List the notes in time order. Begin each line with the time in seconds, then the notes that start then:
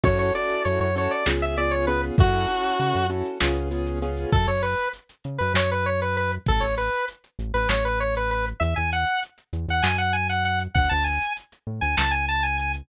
0.03 F#2 C#4 E4 F#4 A4 C#5, kick, closed hi-hat
0.19 C#5, closed hi-hat
0.35 C#4 E4 F#4 A4 D5, closed hi-hat
0.50 closed hi-hat
0.65 F#2 C#5, closed hi-hat
0.80 F#2 C#5, closed hi-hat
0.96 C#4 E4 F#4 A4 C#5, closed hi-hat
1.11 D5, closed hi-hat
1.26 C#2 B3 C#4 F4 G#4, snare
1.41 E5, closed hi-hat
1.57 B3 C#4 F4 G#4 D5, closed hi-hat
1.71 C#5, closed hi-hat
1.87 B3 C#4 F4 G#4 B4, closed hi-hat
2.03 closed hi-hat
2.18 F#2 C#4 E4 F#4 A4, kick, closed hi-hat
2.33 closed hi-hat
2.48 C#4 E4 F#4 A4, closed hi-hat
2.64 closed hi-hat
2.80 C#3, closed hi-hat
2.95 F#2, closed hi-hat
3.10 C#4 E4 F#4 A4, closed hi-hat
3.25 closed hi-hat
3.40 C#2 B3 C#4 F4 G#4, snare
3.56 closed hi-hat
3.71 B3 C#4 F4 G#4, closed hi-hat
3.86 closed hi-hat
4.02 B3 C#4 F4 G#4, closed hi-hat
4.17 closed hi-hat
4.32 F#2 A4, kick, closed hi-hat
4.47 F#2 C#5, closed hi-hat
4.63 B4, closed hi-hat
4.78 closed hi-hat
4.93 closed hi-hat
5.09 closed hi-hat
5.24 C#3, closed hi-hat
5.38 F#2 B4, closed hi-hat
5.54 F#2 C#5, snare
5.70 B4, closed hi-hat
5.86 C#5, closed hi-hat
6.01 B4, closed hi-hat
6.16 B4, closed hi-hat
6.31 closed hi-hat
6.46 A1 A4, kick, closed hi-hat
6.60 A1 C#5, closed hi-hat
6.78 B4, closed hi-hat
6.93 closed hi-hat
7.08 closed hi-hat
7.24 closed hi-hat
7.39 A1, closed hi-hat
7.54 A1 B4, closed hi-hat
7.69 A1 C#5, snare
7.84 B4, closed hi-hat
8.00 C#5, closed hi-hat
8.15 B4, closed hi-hat
8.31 B4, closed hi-hat
8.46 closed hi-hat
8.60 E2 E5, closed hi-hat
8.76 E2 G#5, closed hi-hat
8.92 F#5, closed hi-hat
9.07 closed hi-hat
9.23 closed hi-hat
9.38 closed hi-hat
9.53 E2, closed hi-hat
9.68 E2 F#5, closed hi-hat
9.82 F#2 G#5, snare
9.98 F#5, closed hi-hat
10.13 G#5, closed hi-hat
10.29 F#5, closed hi-hat
10.45 F#5, closed hi-hat
10.60 closed hi-hat
10.74 D2 F#5, kick, closed hi-hat
10.89 D2 A5, closed hi-hat
11.04 G#5, closed hi-hat
11.21 closed hi-hat
11.37 closed hi-hat
11.52 closed hi-hat
11.67 A2
11.81 D2 G#5, closed hi-hat
11.97 C#2 A5, snare
12.11 G#5, closed hi-hat
12.28 A5, closed hi-hat
12.43 G#5, closed hi-hat
12.58 G#5, closed hi-hat
12.74 closed hi-hat